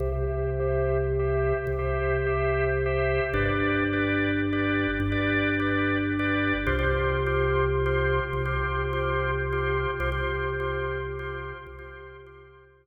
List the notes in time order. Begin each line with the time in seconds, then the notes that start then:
0.00 C2 G4 C5 E5
0.12 G4 C5 E5
0.60 G4 C5 E5
1.19 G4 C5 E5
1.67 C2
1.79 G4 C5 E5
2.26 G4 C5 E5
2.86 G4 C5 E5
3.33 G1 G4 B4 D5
3.45 G4 B4 D5
3.93 G4 B4 D5
4.53 G4 B4 D5
5.00 G1
5.12 G4 B4 D5
5.60 G4 B4 D5
6.19 G4 B4 D5
6.66 C2 F4 G4 C5
6.79 F4 G4 C5
7.26 F4 G4 C5
7.86 F4 G4 C5
8.33 C2
8.45 F4 G4 C5
8.93 F4 G4 C5
9.52 F4 G4 C5
10.00 C2 F4 G4 C5
10.12 F4 G4 C5
10.60 F4 G4 C5
11.19 F4 G4 C5
11.67 C2
11.79 F4 G4 C5
12.26 F4 G4 C5